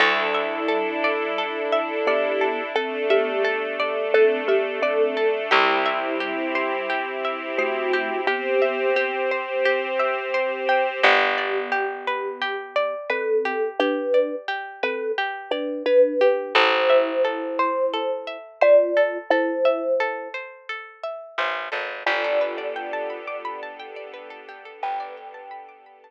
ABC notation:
X:1
M:4/4
L:1/16
Q:1/4=87
K:Dmix
V:1 name="Kalimba"
[G,E]12 [B,G]4 | [CA]2 [B,G]6 [CA]2 [B,G]2 [CA]4 | [G,E]12 [A,F]4 | [B,G]6 z10 |
[K:Gmix] [B,G]12 [CA]4 | [DB]4 z2 [CA]2 z2 [DB]2 [DB]4 | [Ec]12 [Fd]4 | [Ec]6 z10 |
[Fd]16 | [Bg]8 z8 |]
V:2 name="Pizzicato Strings"
A2 e2 A2 d2 A2 e2 d2 A2 | A2 e2 A2 d2 A2 e2 d2 A2 | G2 e2 G2 c2 G2 e2 c2 G2 | G2 e2 G2 c2 G2 e2 c2 G2 |
[K:Gmix] G2 d2 G2 B2 G2 d2 B2 G2 | G2 d2 G2 B2 G2 d2 B2 G2 | A2 e2 A2 c2 A2 e2 c2 A2 | A2 e2 A2 c2 A2 e2 c2 A2 |
G A B d g a b d' b a g d B A G A | B d g a b d' b a z8 |]
V:3 name="Electric Bass (finger)" clef=bass
D,,16- | D,,16 | C,,16- | C,,16 |
[K:Gmix] G,,,16- | G,,,16 | A,,,16- | A,,,12 A,,,2 ^G,,,2 |
G,,,16 | G,,,16 |]
V:4 name="String Ensemble 1"
[DEA]16 | [A,DA]16 | [CEG]16 | [CGc]16 |
[K:Gmix] z16 | z16 | z16 | z16 |
[B,DGA]16- | [B,DGA]16 |]